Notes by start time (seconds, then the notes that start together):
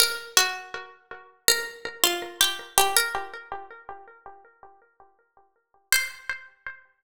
0.00 A#4
0.37 F#4
1.48 A#4
2.04 F4
2.41 G4
2.78 G4
2.96 A#4
5.92 C5